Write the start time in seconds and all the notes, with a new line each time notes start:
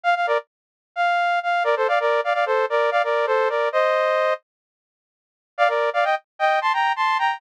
0.04 F5
0.15 F5
0.27 A#4 D5
0.96 F5
1.43 F5
1.64 A#4 D5
1.76 A4 C5
1.88 D5 F5
2.00 A#4 D5
2.24 D5 F5
2.34 D5 F5
2.46 A4 C5
2.70 A#4 D5
2.91 D5 F5
3.04 A#4 D5
3.27 A4 C5
3.49 A#4 D5
3.72 C5 D#5
5.58 D5 F5
5.68 A#4 D5
5.93 D5 F5
6.04 D#5 G5
6.39 D#5 G5
6.62 A5 C6
6.73 G5 A#5
6.96 A5 C6
7.19 G5 A#5